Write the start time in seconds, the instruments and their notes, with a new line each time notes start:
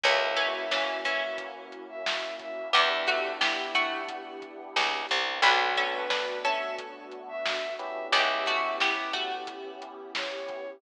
0.04 electric bass (finger) C#2, pizzicato strings E3 C#4, pad 2 (warm) A#3 C#4 E4 F#4, electric piano 1 A#3 C#4 E4 F#4, violin E5, kick, closed hi-hat
0.37 pizzicato strings E3 C#4, closed hi-hat
0.54 violin E5
0.71 pizzicato strings E3 C#4, snare
1.05 pizzicato strings E3 C#4, violin E5, kick, closed hi-hat
1.38 kick, closed hi-hat
1.72 closed hi-hat
1.89 violin E5
2.06 snare
2.39 violin E5, kick, closed hi-hat
2.73 electric bass (finger) E2, electric piano 1 B3 D4 E4 G4, pizzicato strings B3 G4, pad 2 (warm) B3 D4 E4 G4, violin E5, kick, closed hi-hat
3.07 pizzicato strings A3 F#4, kick, closed hi-hat
3.40 pizzicato strings B3 G4, violin E4, snare
3.74 pizzicato strings A3 F#4, kick, closed hi-hat
4.09 kick, closed hi-hat
4.42 kick, closed hi-hat
4.76 electric bass (finger) C#2, snare
5.09 electric bass (finger) C2, closed hi-hat
5.42 electric bass (finger) B1, electric piano 1 A3 B3 D4 F#4, pad 2 (warm) A3 B3 D4 F#4, pizzicato strings D4 B4, violin F#4, kick, closed hi-hat
5.77 pizzicato strings C#4 A4, kick, closed hi-hat
5.93 violin B4
6.10 pizzicato strings D4 B4, snare
6.44 pizzicato strings C#4 A4, violin E5, kick, snare, closed hi-hat
6.78 kick, closed hi-hat
7.12 closed hi-hat
7.28 violin E5
7.46 snare
7.79 electric piano 1 B3 C#4 E4 G4, violin E5, closed hi-hat
8.12 electric bass (finger) C#2, pizzicato strings B3 G4, pad 2 (warm) B3 C#4 E4 G4, violin E5, kick, closed hi-hat
8.46 pizzicato strings A3 F#4, kick, closed hi-hat
8.80 pizzicato strings B3 G4, violin E4, snare
9.13 pizzicato strings A3 F#4, kick, closed hi-hat
9.47 kick, closed hi-hat
9.82 closed hi-hat
10.15 violin C#5, snare
10.48 kick, closed hi-hat